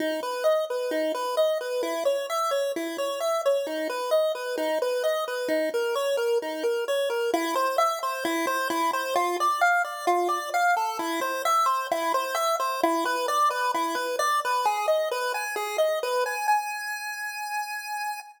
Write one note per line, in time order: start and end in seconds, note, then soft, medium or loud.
0.00 0.21 D#4 medium
0.23 0.44 B4 medium
0.44 0.65 D#5 medium
0.70 0.91 B4 medium
0.91 1.12 D#4 medium
1.15 1.36 B4 medium
1.37 1.58 D#5 medium
1.61 1.82 B4 medium
1.83 2.04 E4 medium
2.05 2.26 C#5 medium
2.30 2.51 E5 medium
2.51 2.72 C#5 medium
2.76 2.97 E4 medium
2.98 3.19 C#5 medium
3.20 3.42 E5 medium
3.46 3.67 C#5 medium
3.67 3.88 D#4 medium
3.90 4.11 B4 medium
4.11 4.32 D#5 medium
4.35 4.56 B4 medium
4.58 4.79 D#4 medium
4.82 5.03 B4 medium
5.04 5.25 D#5 medium
5.28 5.49 B4 medium
5.48 5.69 D#4 medium
5.74 5.95 A#4 medium
5.95 6.17 C#5 medium
6.17 6.38 A#4 medium
6.42 6.63 D#4 medium
6.63 6.85 A#4 medium
6.88 7.09 C#5 medium
7.10 7.31 A#4 medium
7.33 7.55 E4 loud
7.55 7.77 C5 loud
7.78 7.99 E5 loud
8.03 8.24 C5 loud
8.25 8.46 E4 loud
8.47 8.68 C5 loud
8.70 8.91 E4 loud
8.93 9.14 C5 loud
9.16 9.37 F4 loud
9.40 9.61 D5 loud
9.61 9.82 F5 loud
9.84 10.06 D5 loud
10.07 10.28 F4 loud
10.29 10.50 D5 loud
10.54 10.75 F5 loud
10.77 10.98 A4 loud
10.99 11.20 E4 loud
11.21 11.42 C5 loud
11.45 11.66 E5 loud
11.66 11.87 C5 loud
11.91 12.12 E4 loud
12.14 12.35 C5 loud
12.35 12.56 E5 loud
12.60 12.81 C5 loud
12.83 13.04 E4 loud
13.05 13.26 B4 loud
13.28 13.49 D5 loud
13.50 13.72 B4 loud
13.74 13.96 E4 loud
13.95 14.16 B4 loud
14.19 14.40 D5 loud
14.45 14.66 B4 loud
14.65 14.86 G#4 loud
14.88 15.09 D#5 medium
15.11 15.33 B4 loud
15.34 15.55 G#5 medium
15.56 15.77 G#4 loud
15.78 15.99 D#5 medium
16.03 16.24 B4 loud
16.26 16.47 G#5 medium
16.48 18.20 G#5 loud